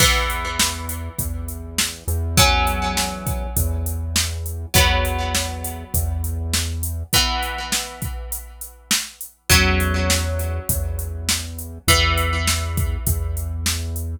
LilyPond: <<
  \new Staff \with { instrumentName = "Acoustic Guitar (steel)" } { \time 4/4 \key e \mixolydian \tempo 4 = 101 <e b>1 | <fis cis'>1 | <fis b>1 | <e b>1 |
<fis cis'>1 | <e b>1 | }
  \new Staff \with { instrumentName = "Synth Bass 1" } { \clef bass \time 4/4 \key e \mixolydian e,2 e,4. e,8~ | e,2 e,2 | e,2 e,2 | r1 |
e,2 e,2 | e,2 e,2 | }
  \new DrumStaff \with { instrumentName = "Drums" } \drummode { \time 4/4 <cymc bd>8 hh8 sn8 hh8 <hh bd>8 hh8 sn8 hh8 | <hh bd>8 hh8 sn8 <hh bd>8 <hh bd>8 hh8 sn8 hh8 | <hh bd>8 hh8 sn8 hh8 <hh bd>8 hh8 sn8 hh8 | <hh bd>8 hh8 sn8 <hh bd>8 hh8 hh8 sn8 hh8 |
<hh bd>8 hh8 sn8 hh8 <hh bd>8 hh8 sn8 hh8 | <hh bd>8 hh8 sn8 <hh bd>8 <hh bd>8 hh8 sn8 hh8 | }
>>